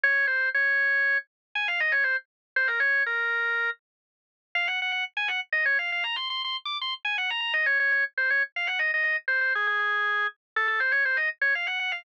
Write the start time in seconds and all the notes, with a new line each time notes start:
0.04 C#5
0.27 C5
0.54 C#5
1.55 G#5
1.68 F5
1.80 D#5
1.92 C#5
2.04 C5
2.56 C5
2.68 A#4
2.80 C#5
3.06 A#4
4.55 F5
4.68 F#5
4.82 F#5
4.92 F#5
5.17 G#5
5.28 F#5
5.53 D#5
5.66 C#5
5.79 F5
5.92 F5
6.04 A#5
6.16 C6
6.30 C6
6.44 C6
6.65 D6
6.81 C6
7.05 G#5
7.18 F#5
7.30 A#5
7.41 A#5
7.54 D#5
7.66 C#5
7.80 C#5
7.92 C#5
8.18 C5
8.30 C#5
8.56 F5
8.67 F#5
8.79 D#5
8.94 D#5
9.04 D#5
9.28 C5
9.41 C5
9.55 G#4
9.67 G#4
9.79 G#4
10.56 A4
10.68 A4
10.80 C5
10.92 C#5
11.05 C5
11.17 D#5
11.41 C#5
11.55 F5
11.67 F#5
11.80 F#5
11.92 F5